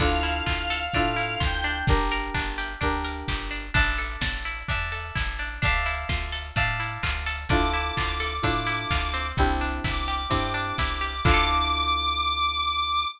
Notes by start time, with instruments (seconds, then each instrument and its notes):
0.00 electric bass (finger) D2, electric piano 2 D4 E4 F4 A4, acoustic guitar (steel) D4, choir aahs F5, kick, crash
0.23 acoustic guitar (steel) E4, open hi-hat
0.46 electric bass (finger) D2, acoustic guitar (steel) F4, kick, clap
0.70 acoustic guitar (steel) A4, open hi-hat
0.94 electric bass (finger) A2, acoustic guitar (steel) D4, electric piano 2 D4 E4 F4 A4, kick, closed hi-hat
1.16 acoustic guitar (steel) E4, open hi-hat
1.40 electric bass (finger) D2, acoustic guitar (steel) F4, choir aahs G5, kick, clap
1.64 acoustic guitar (steel) D4, open hi-hat
1.87 electric bass (finger) G1, electric piano 2 D4 G4 A#4, kick, closed hi-hat
2.11 acoustic guitar (steel) A#4, open hi-hat
2.34 electric bass (finger) G1, acoustic guitar (steel) D4, kick, clap
2.58 acoustic guitar (steel) G4, open hi-hat
2.81 electric bass (finger) D2, acoustic guitar (steel) D4, electric piano 2 D4 G4 A#4, kick, closed hi-hat
3.04 acoustic guitar (steel) A#4, open hi-hat
3.28 electric bass (finger) G1, acoustic guitar (steel) G4, kick, clap
3.51 acoustic guitar (steel) D4, open hi-hat
3.74 electric bass (finger) A1, acoustic guitar (steel) D4, electric piano 2 D5 E5 A5, kick, closed hi-hat
3.98 acoustic guitar (steel) A4, open hi-hat
4.21 electric bass (finger) A1, acoustic guitar (steel) D4, kick, snare
4.45 acoustic guitar (steel) E4, open hi-hat
4.68 electric bass (finger) E2, acoustic guitar (steel) D4, electric piano 2 D5 E5 A5, kick, closed hi-hat
4.92 acoustic guitar (steel) A4, open hi-hat
5.15 electric bass (finger) A1, acoustic guitar (steel) E4, kick, clap
5.39 acoustic guitar (steel) D4, open hi-hat
5.62 electric bass (finger) D2, acoustic guitar (steel) D4, electric piano 2 D5 E5 F5 A5, kick, closed hi-hat
5.86 acoustic guitar (steel) E4, open hi-hat
6.09 electric bass (finger) D2, acoustic guitar (steel) F4, kick, snare
6.32 acoustic guitar (steel) A4, open hi-hat
6.56 electric bass (finger) A2, acoustic guitar (steel) D4, electric piano 2 D5 E5 F5 A5, kick, closed hi-hat
6.80 acoustic guitar (steel) E4, open hi-hat
7.03 electric bass (finger) D2, acoustic guitar (steel) F4, kick, clap
7.26 acoustic guitar (steel) A4, open hi-hat
7.49 electric bass (finger) D2, electric piano 2 D4 E4 F4 A4, acoustic guitar (steel) D4, choir aahs D6, kick, closed hi-hat
7.73 acoustic guitar (steel) E4, open hi-hat
7.97 electric bass (finger) D2, acoustic guitar (steel) F4, kick, clap
8.20 acoustic guitar (steel) A4, open hi-hat
8.42 electric bass (finger) A2, electric piano 2 D4 E4 F4 A4, acoustic guitar (steel) D4, kick, closed hi-hat
8.67 acoustic guitar (steel) E4, open hi-hat
8.91 electric bass (finger) D2, acoustic guitar (steel) F4, kick, clap
9.14 acoustic guitar (steel) C4, open hi-hat
9.37 electric bass (finger) C2, electric piano 2 C4 D4 E4 G4, kick
9.61 acoustic guitar (steel) D4, open hi-hat
9.84 electric bass (finger) C2, acoustic guitar (steel) E4, choir aahs D6, kick, clap
10.08 acoustic guitar (steel) G4, open hi-hat
10.29 electric bass (finger) G2, electric piano 2 C4 D4 E4 G4, acoustic guitar (steel) C4, kick, closed hi-hat
10.54 acoustic guitar (steel) D4, open hi-hat
10.78 electric bass (finger) C2, acoustic guitar (steel) E4, kick, snare
11.01 acoustic guitar (steel) G4, open hi-hat
11.24 electric bass (finger) D2, electric piano 2 D4 E4 F4 A4, acoustic guitar (steel) D4, choir aahs D6, kick, crash
11.28 acoustic guitar (steel) E4 F4
11.34 acoustic guitar (steel) A4